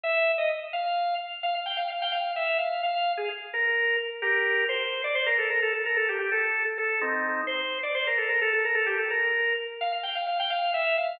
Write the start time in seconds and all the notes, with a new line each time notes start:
0.03 E5
0.38 D#5
0.73 F5
1.43 F5
1.66 G5
1.77 F5
1.90 F5
2.02 G5
2.12 F5
2.36 E5
2.58 F5
2.83 F5
3.17 G#4
3.53 A#4
4.22 G4 A#4
4.69 C5
5.04 D5
5.15 C5
5.26 A#4
5.38 A4
5.49 A#4
5.62 A4
5.73 A4
5.86 A#4
5.97 A4
6.09 G4
6.19 G4
6.32 A4
6.78 A4
7.01 C4 D#4
7.47 C5
7.83 D5
7.95 C5
8.07 A#4
8.17 A4
8.29 A#4
8.41 A4
8.53 A4
8.65 A#4
8.75 A4
8.86 G4
8.98 A4
9.10 A#4
9.81 F5
10.03 G5
10.15 F5
10.27 F5
10.40 G5
10.50 F5
10.74 E5
10.97 F5